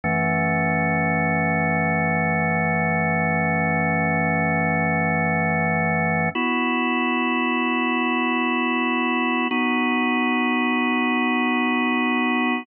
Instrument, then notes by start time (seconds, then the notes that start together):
drawbar organ
0.04 F#2 E3 A3 C#4
6.35 B3 E4 F#4
9.51 B3 D#4 F#4